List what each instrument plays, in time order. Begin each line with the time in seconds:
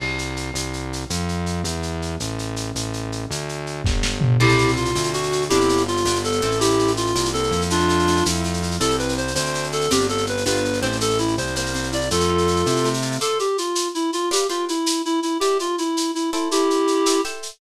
0.00 synth bass 1 C2, crash
0.19 shaker
0.37 shaker
0.54 synth bass 1 C2, shaker
0.73 shaker
0.93 shaker
1.10 synth bass 1 F2, shaker
1.29 shaker
1.46 shaker
1.64 synth bass 1 E2, shaker
1.83 shaker
2.02 shaker
2.20 synth bass 1 A1, shaker
2.39 shaker
2.56 shaker
2.75 synth bass 1 A1, shaker
2.93 shaker
3.12 shaker
3.30 synth bass 1 D2, shaker
3.49 shaker
3.67 shaker
3.84 synth bass 1 G1, kick, snare
4.03 snare
4.21 floor tom
4.40 synth bass 1 C2, acoustic guitar (steel) C4 E4 G4 A4, clarinet E4 G4, crash
4.49 shaker
4.58 shaker
4.68 shaker
4.76 clarinet F4, shaker
4.85 shaker
4.95 synth bass 1 D2, acoustic guitar (steel) C4, shaker
5.04 shaker
5.13 acoustic guitar (steel) D4, clarinet F#4, shaker
5.23 shaker
5.32 acoustic guitar (steel) F#4, shaker
5.41 shaker
5.49 synth bass 1 G1, acoustic guitar (steel) C4 D4 F4 G4, clarinet E4 G4, shaker
5.60 shaker
5.69 shaker
5.77 shaker
5.87 clarinet F4, shaker
5.97 shaker
6.05 synth bass 1 G1, acoustic guitar (steel) B3 D4 F4 G4, shaker
6.15 shaker
6.24 clarinet A4, shaker
6.32 shaker
6.41 synth bass 1 A1, acoustic guitar (steel) A3 C4 E4 G4, shaker
6.51 shaker
6.60 clarinet E4 G4, shaker
6.70 shaker
6.79 shaker
6.87 shaker
6.97 clarinet F4, shaker
7.07 shaker
7.15 synth bass 1 C2, acoustic guitar (steel) A#3, shaker
7.25 shaker
7.33 acoustic guitar (steel) C4, clarinet A4, shaker
7.43 shaker
7.51 synth bass 1 F2, acoustic guitar (steel) E4, shaker
7.61 shaker
7.70 acoustic guitar (steel) A3, clarinet D4 F4, shaker
7.80 shaker
7.89 acoustic guitar (steel) F4, shaker
7.99 shaker
8.07 acoustic guitar (steel) A3, shaker
8.17 shaker
8.26 synth bass 1 F2, acoustic guitar (steel) E4, shaker
8.35 shaker
8.44 acoustic guitar (steel) A3, shaker
8.54 shaker
8.62 acoustic guitar (steel) F4, shaker
8.71 shaker
8.80 synth bass 1 C2, acoustic guitar (steel) C4 E4 G4 A4, clarinet A4, shaker
8.90 shaker
8.98 clarinet B4, shaker
9.09 shaker
9.17 clarinet C5, shaker
9.27 shaker
9.35 synth bass 1 D2, acoustic guitar (steel) C4, clarinet C5, shaker
9.45 shaker
9.54 acoustic guitar (steel) D4, shaker
9.63 shaker
9.72 acoustic guitar (steel) F#4, clarinet A4, shaker
9.81 shaker
9.91 synth bass 1 G1, acoustic guitar (steel) C4 D4 F4 G4, clarinet G4, shaker
10.00 shaker
10.09 clarinet A4, shaker
10.18 shaker
10.26 clarinet B4, shaker
10.37 shaker
10.46 synth bass 1 G1, acoustic guitar (steel) B3 D4 F4 G4, clarinet B4, shaker
10.56 shaker
10.65 shaker
10.73 shaker
10.81 synth bass 1 A1, acoustic guitar (steel) A3 C4 E4 G4, clarinet C5, shaker
10.92 shaker
11.01 clarinet A4, shaker
11.10 shaker
11.18 clarinet E4, shaker
11.28 shaker
11.37 synth bass 1 C2, clarinet C5, shaker
11.47 shaker
11.56 acoustic guitar (steel) A#3, clarinet C5, shaker
11.66 shaker
11.74 acoustic guitar (steel) C4, shaker
11.83 shaker
11.92 acoustic guitar (steel) E4, clarinet D5, shaker
12.01 shaker
12.11 synth bass 1 F2, acoustic guitar (steel) A3, clarinet F4 A4, shaker
12.20 shaker
12.29 acoustic guitar (steel) F4
12.38 shaker
12.48 acoustic guitar (steel) A3, shaker
12.56 shaker
12.66 synth bass 1 C3, acoustic guitar (steel) E4, shaker
12.76 shaker
12.84 acoustic guitar (steel) A3, shaker
12.94 shaker
13.02 acoustic guitar (steel) F4, shaker
13.12 shaker
13.21 acoustic guitar (steel) F4 C5 D5 A5, clarinet A4, shaker
13.39 clarinet G4, shaker
13.58 clarinet F4, shaker
13.75 shaker
13.95 clarinet E4, shaker
14.13 clarinet F4, shaker
14.31 acoustic guitar (steel) G4 B4 D5 F5, clarinet G4, shaker
14.49 clarinet F4, acoustic guitar (steel) G4 B4 D5 F5, shaker
14.68 clarinet E4, shaker
14.86 shaker
15.05 clarinet E4, shaker
15.23 clarinet E4, shaker
15.40 acoustic guitar (steel) E4 B4 D5 G5, clarinet G4, shaker
15.59 clarinet F4, shaker
15.78 clarinet E4, shaker
15.97 shaker
16.15 clarinet E4, shaker
16.33 clarinet E4, acoustic guitar (steel) A4 C5 E5 G5, shaker
16.51 clarinet E4 G4, shaker
16.70 shaker
16.87 shaker
17.06 acoustic guitar (steel) A4 C5 E5 G5, shaker
17.24 acoustic guitar (steel) A4 C5 E5 G5, shaker
17.43 shaker